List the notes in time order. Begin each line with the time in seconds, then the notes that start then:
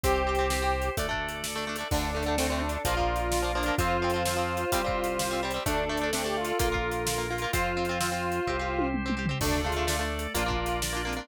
0.03 C2 C4 G4 C5, kick, closed hi-hat
0.27 C4 G4
0.35 C4, closed hi-hat
0.41 G4
0.50 C4 G4, snare
0.62 C4 G4
0.82 closed hi-hat
0.97 D2 A3 D4 A4 D5, kick, closed hi-hat
1.09 A3 D4
1.13 kick
1.29 closed hi-hat
1.44 snare
1.56 A3 D4
1.67 A3 D4
1.76 A3, closed hi-hat
1.80 D4
1.91 D2 D3 A3 D4 A4 D5, kick, crash
2.15 D3 A3
2.23 D3, closed hi-hat
2.28 A3
2.38 D3 A3 C4, snare
2.50 D3 A3 C4
2.61 D4
2.69 closed hi-hat
2.85 A#1 F3 A#3 F4 A#4, kick, closed hi-hat
2.97 F3 A#3, kick
3.16 closed hi-hat
3.32 snare
3.42 F3 A#3
3.55 F3 A#3 D4
3.63 F3, closed hi-hat
3.68 A#3
3.78 F2 F3 C4 F4 C5, kick, closed hi-hat
4.02 F3 C4
4.10 closed hi-hat
4.14 F3 C4
4.25 F3 C4, snare
4.37 F3 C4
4.57 closed hi-hat
4.72 C2 G3 C4 G4 C5, kick, closed hi-hat
4.84 G3 C4, kick
5.04 closed hi-hat
5.19 snare
5.31 G3 C4
5.43 G3 C4
5.51 G3, closed hi-hat
5.56 C4
5.66 D2 A3 D4 A4 D5, kick, closed hi-hat
5.89 A3 D4
5.97 closed hi-hat
6.01 A3 D4
6.13 A3 C4 D4, snare
6.24 A3 D4 G4
6.37 F4
6.45 closed hi-hat
6.59 A#1 A#3 F4 A#4, kick, closed hi-hat
6.72 A#3 F4, kick
6.91 closed hi-hat
7.07 snare
7.18 A#3 F4
7.30 A#3 F4
7.38 A#3, closed hi-hat
7.44 F4
7.53 F2 C4 F4 C5, kick, closed hi-hat
7.77 C4 F4
7.85 closed hi-hat
7.89 C4 F4
8.00 C4 F4, snare
8.12 C4 F4
8.32 closed hi-hat
8.47 C2 C4 G4 C5, kick
8.59 C4 G4
8.79 high tom
8.94 mid tom
9.06 C4 G4, mid tom
9.17 C4 G4
9.26 C4, floor tom
9.31 G4
9.40 D2 A3 D4 A4 D5, kick, crash
9.64 A3 D4 F4 G#4
9.72 closed hi-hat
9.76 A3 D4
9.87 A3 D4, snare
9.99 A3 D4
10.19 closed hi-hat
10.34 A#1 A#3 D4 F4 A#4 D5, kick, closed hi-hat
10.46 A#3 D4 F4
10.51 kick
10.58 F4
10.66 closed hi-hat
10.82 D4 F4 D5, snare
10.93 A#3 D4 F4
11.05 A#3 C4 D4 F4
11.13 closed hi-hat
11.17 A#3 D4 F4